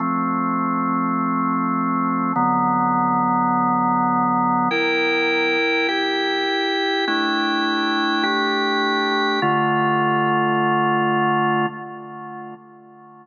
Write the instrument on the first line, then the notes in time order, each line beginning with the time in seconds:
drawbar organ
0.00 F3 A3 C4
2.36 D3 F#3 B3
4.71 E4 A#4 G5
5.88 E4 G4 G5
7.07 A3 D4 E4 G5
8.23 A3 D4 G4 G5
9.42 D3 A3 F4